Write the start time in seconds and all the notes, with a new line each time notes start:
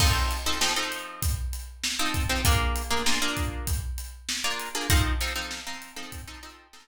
0.00 F3 C4 D#4 A4, kick, crash
0.31 closed hi-hat
0.46 F3 C4 D#4 A4
0.61 F3 C4 D#4 A4, snare
0.76 F3 C4 D#4 A4
0.92 closed hi-hat
1.22 kick, closed hi-hat
1.53 closed hi-hat
1.84 snare
1.99 F3 C4 D#4 A4
2.14 kick, closed hi-hat
2.29 F3 C4 D#4 A4
2.45 A#3 D4 F4 G#4, kick, closed hi-hat
2.76 closed hi-hat
2.91 A#3 D4 F4 G#4
3.06 A#3 D4 F4 G#4, snare
3.22 A#3 D4 F4 G#4
3.37 kick, closed hi-hat
3.67 kick, closed hi-hat
3.98 closed hi-hat
4.29 snare
4.44 A#3 D4 F4 G#4
4.59 closed hi-hat
4.75 A#3 D4 F4 G#4
4.90 F3 C4 D#4 A4, kick, closed hi-hat
5.21 F3 C4 D#4 A4, closed hi-hat
5.36 F3 C4 D#4 A4
5.51 snare
5.67 F3 C4 D#4 A4
5.82 closed hi-hat
5.96 F3 C4 D#4 A4
6.12 kick, closed hi-hat
6.28 F3 C4 D#4 A4
6.43 F3 C4 D#4 A4, closed hi-hat
6.73 F3 C4 D#4 A4, snare